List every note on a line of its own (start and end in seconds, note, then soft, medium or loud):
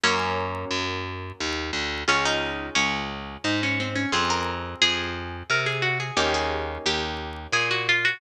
0.04 0.65 F#2 loud
0.04 2.04 F#3 medium
0.04 2.04 A#3 medium
0.04 2.04 C#4 medium
0.04 0.88 C#4 loud
0.71 1.32 F#2 medium
1.40 1.71 D#2 medium
1.73 2.04 D2 medium
2.08 2.70 C#2 medium
2.08 4.08 C#4 medium
2.08 2.25 C#4 loud
2.08 4.08 F4 medium
2.08 4.08 G#4 medium
2.25 2.67 D#4 medium
2.75 3.37 C#2 medium
2.75 3.35 C#4 medium
3.44 4.06 G#2 medium
3.44 3.61 D#4 medium
3.63 3.79 C#4 medium
3.80 3.96 C4 medium
3.95 4.12 C#4 medium
4.12 4.75 F2 loud
4.12 6.13 C4 medium
4.12 6.13 F4 medium
4.12 6.13 G#4 medium
4.12 4.29 G#4 loud
4.30 4.77 A#4 loud
4.82 5.43 F2 medium
4.82 5.37 G#4 medium
5.50 6.11 C3 medium
5.50 5.67 A#4 medium
5.66 5.83 G#4 medium
5.82 5.98 F#4 medium
6.00 6.16 G#4 medium
6.17 6.78 D#2 medium
6.17 8.17 A#3 medium
6.17 8.17 C#4 medium
6.17 8.17 D#4 medium
6.17 8.17 G4 medium
6.17 6.33 G4 loud
6.34 6.79 G#4 medium
6.86 7.47 D#2 medium
6.86 7.43 G4 medium
7.52 8.14 A#2 medium
7.52 7.69 G#4 loud
7.71 7.87 F#4 medium
7.89 8.05 F4 loud
8.05 8.20 F#4 loud